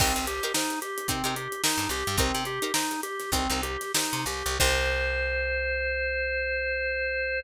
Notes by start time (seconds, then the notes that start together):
0.00 C2 C4 D#4 G4 A#4 C5, kick, crash
0.16 C2, snare, closed hi-hat
0.27 G4, closed hi-hat
0.43 D#4 G4 A#4 C5, closed hi-hat
0.54 D#4 G4 A#4 C5, snare
0.70 closed hi-hat
0.82 G4, closed hi-hat
0.98 closed hi-hat
1.08 C3 C4 D#4 G4 A#4 C5, kick, closed hi-hat
1.24 C3 D#4 G4 A#4 C5, closed hi-hat
1.36 G4, closed hi-hat
1.52 closed hi-hat
1.64 D#4 G4 A#4 C5, snare
1.78 G2, closed hi-hat
1.89 C2 G4, snare, closed hi-hat
2.07 G2, snare, closed hi-hat
2.18 C2 C4 D#4 G4 A#4 C5, kick, closed hi-hat
2.34 C3, snare, closed hi-hat
2.45 G4, closed hi-hat
2.62 D#4 G4 A#4 C5, closed hi-hat
2.74 D#4 G4 A#4 C5, snare
2.91 snare, closed hi-hat
3.03 G4, closed hi-hat
3.20 snare, closed hi-hat
3.32 C2 C4 D#4 G4 A#4 C5, kick, closed hi-hat
3.49 C2 D#4 G4 A#4 C5, closed hi-hat
3.63 G4, closed hi-hat
3.81 snare, closed hi-hat
3.94 D#4 G4 A#4 C5, snare
4.13 C3, closed hi-hat
4.26 C2 G4, snare, closed hi-hat
4.46 C2, closed hi-hat
4.60 C2 D#4 G4 A#4 C5, kick, crash